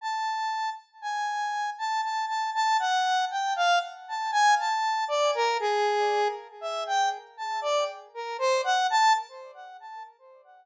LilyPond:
\new Staff { \time 9/8 \tempo 4. = 39 a''8. r16 gis''8. a''16 a''16 a''16 a''16 fis''8 g''16 f''16 r16 a''16 gis''16 | a''8 d''16 ais'16 gis'8. r16 e''16 g''16 r16 a''16 d''16 r16 ais'16 c''16 fis''16 a''16 | }